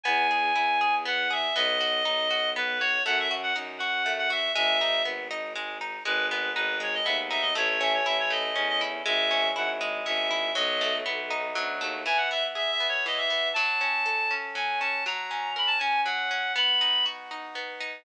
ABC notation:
X:1
M:3/4
L:1/16
Q:1/4=120
K:E
V:1 name="Clarinet"
g8 f2 e2 | d8 B2 c2 | f e z f z2 f3 f e2 | e4 z8 |
B2 B2 B2 c d e z e d | c c e c e c d3 d z2 | e4 f z3 e4 | d4 z8 |
g f e z (3e2 e2 c2 d e3 | a8 g2 a2 | ^a4 b =a g2 f4 | b4 z8 |]
V:2 name="Orchestral Harp"
B,2 G2 E2 G2 B,2 G2 | B,2 F2 D2 F2 B,2 F2 | A,2 F2 D2 F2 A,2 F2 | G,2 D2 B,2 D2 G,2 D2 |
G,2 B,2 D2 G,2 B,2 D2 | A,2 C2 E2 A,2 C2 E2 | G,2 C2 E2 G,2 C2 E2 | F,2 A,2 B,2 D2 F,2 A,2 |
E,2 B,2 G2 B,2 E,2 B,2 | F,2 C2 A2 C2 F,2 C2 | F,2 C2 ^A2 C2 F,2 C2 | B,2 D2 F2 D2 B,2 D2 |]
V:3 name="Violin" clef=bass
E,,4 E,,8 | B,,,4 B,,,8 | F,,4 F,,8 | G,,,4 G,,,8 |
G,,,4 G,,,4 D,,4 | A,,,4 A,,,4 E,,4 | G,,,4 G,,,4 G,,,4 | B,,,4 B,,,4 =D,,2 ^D,,2 |
z12 | z12 | z12 | z12 |]